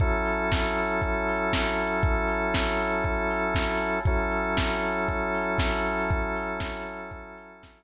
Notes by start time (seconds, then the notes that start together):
0.00 F#3 C#4 E4 A4, kick, closed hi-hat
0.13 closed hi-hat
0.25 open hi-hat
0.40 closed hi-hat
0.52 kick, snare
0.64 closed hi-hat
0.75 open hi-hat
0.89 closed hi-hat
1.02 kick, closed hi-hat
1.14 closed hi-hat
1.28 open hi-hat
1.40 closed hi-hat
1.53 kick, snare
1.65 closed hi-hat
1.77 open hi-hat
1.92 closed hi-hat
2.03 kick, closed hi-hat
2.17 closed hi-hat
2.28 open hi-hat
2.42 closed hi-hat
2.54 kick, snare
2.68 closed hi-hat
2.80 open hi-hat
2.92 closed hi-hat
3.04 kick, closed hi-hat
3.17 closed hi-hat
3.30 open hi-hat
3.44 closed hi-hat
3.55 kick, snare
3.70 closed hi-hat
3.81 open hi-hat
3.93 closed hi-hat
4.05 F#3 C#4 E4 A4, kick, closed hi-hat
4.20 closed hi-hat
4.31 open hi-hat
4.45 closed hi-hat
4.57 kick, snare
4.69 closed hi-hat
4.83 open hi-hat
4.95 closed hi-hat
5.08 kick, closed hi-hat
5.20 closed hi-hat
5.34 open hi-hat
5.47 closed hi-hat
5.58 kick, snare
5.72 closed hi-hat
5.84 open hi-hat
5.98 open hi-hat
6.10 kick, closed hi-hat
6.22 closed hi-hat
6.36 open hi-hat
6.49 closed hi-hat
6.60 kick, snare
6.73 closed hi-hat
6.86 open hi-hat
7.00 closed hi-hat
7.11 kick, closed hi-hat
7.25 closed hi-hat
7.38 open hi-hat
7.50 closed hi-hat
7.63 kick, snare
7.75 closed hi-hat